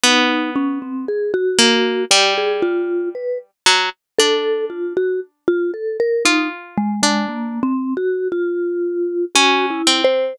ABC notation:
X:1
M:2/4
L:1/16
Q:1/4=58
K:none
V:1 name="Pizzicato Strings"
B,6 ^A,2 | G,6 ^F, z | D8 | F3 D3 z2 |
z4 ^C2 =C2 |]
V:2 name="Vibraphone"
^D2 ^C =C ^G ^F3 | G ^G F2 B z3 | A2 F ^F z =F A ^A | ^D z ^G, G, (3^A,2 C2 ^F2 |
F4 (3^F2 E2 c2 |]